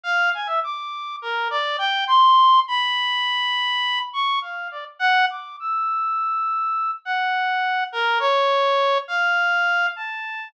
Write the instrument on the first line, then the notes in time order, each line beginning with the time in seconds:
clarinet
0.04 F5
0.34 G#5
0.46 E5
0.64 D6
1.22 A#4
1.50 D5
1.78 G5
2.07 C6
2.68 B5
4.13 C#6
4.42 F5
4.71 D5
4.99 F#5
5.30 D6
5.60 E6
7.05 F#5
7.92 A#4
8.19 C#5
9.08 F5
9.96 A5